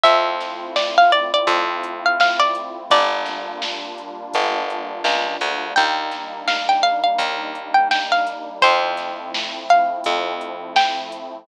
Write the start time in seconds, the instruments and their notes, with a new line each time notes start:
0.04 electric bass (finger) F2, pad 2 (warm) A3 C4 E4 F4, pizzicato strings E5, kick, closed hi-hat
0.40 snare, closed hi-hat
0.76 pizzicato strings D5, snare
0.98 pizzicato strings F5
1.12 pizzicato strings D5, closed hi-hat
1.34 pizzicato strings D5
1.47 electric bass (finger) F2, kick, closed hi-hat
1.83 closed hi-hat
2.06 pizzicato strings F5
2.20 pizzicato strings F5, snare
2.40 pizzicato strings D5
2.55 closed hi-hat
2.90 electric bass (finger) G1, pad 2 (warm) G3 A#3 D4 F4, pizzicato strings D5, kick, closed hi-hat
3.26 snare, closed hi-hat
3.62 snare
3.98 closed hi-hat
4.34 electric bass (finger) G1, kick, closed hi-hat
4.70 closed hi-hat
5.04 electric bass (finger) C#2, snare
5.41 electric bass (finger) D2, closed hi-hat
5.76 electric bass (finger) D#2, pad 2 (warm) G3 A#3 D4 D#4, pizzicato strings G5, kick, closed hi-hat
6.11 snare, closed hi-hat
6.48 pizzicato strings F5, snare
6.69 pizzicato strings G5
6.83 pizzicato strings F5, closed hi-hat
7.04 pizzicato strings F5
7.18 electric bass (finger) D#2, kick, closed hi-hat
7.55 closed hi-hat
7.74 pizzicato strings G5
7.91 pizzicato strings G5, snare
8.12 pizzicato strings F5
8.27 snare, closed hi-hat
8.62 electric bass (finger) F2, pad 2 (warm) F3 A3 C4 E4, pizzicato strings C5, kick, closed hi-hat
8.97 snare, closed hi-hat
9.34 snare
9.69 pizzicato strings F5, closed hi-hat
10.04 electric bass (finger) F2, kick, closed hi-hat
10.41 closed hi-hat
10.76 pizzicato strings G5, snare
11.12 closed hi-hat